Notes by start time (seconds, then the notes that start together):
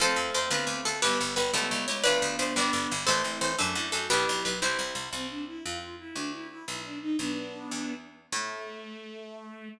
0.00 F2 A3 C4 F4 A4 C5
0.16 F2
0.34 F2 C5
0.50 D2 B3 D4 F4 B4
0.67 D2
0.85 D2 A4
1.02 G1 G3 B3 E4 G4 B4
1.20 G1
1.36 G1 B4
1.53 C#2 A3 C#4 E4 A4
1.71 C#2
1.88 C#2 C#5
2.04 D2 A3 B3 D4 F4 B4 D5
2.22 D2
2.39 D2 C5
2.56 G1 G3 B3 D4 D5
2.73 G1
2.91 G1
3.07 A1 A3 C4 E4 A4 C5
3.24 A1
3.41 A1 C5
3.59 F#2 A3 D4 F#4 A4
3.75 F#2 E4
3.92 F#2 F#4 A4
4.10 B1 B3 D4 E4 G4 B4
4.29 B1
4.45 B1 B4
4.62 C2 C4 E4 G4 C5
4.79 C2
4.95 C2
5.13 C2 C4
5.30 D4
5.47 E4
5.64 F2 F4
5.81 F4
5.99 E4
6.15 D2 D4
6.33 E4
6.50 E4
6.67 B1 E4
6.84 D4
7.01 D#4
7.18 B1 B3 D4
7.71 E2
8.32 A2 A3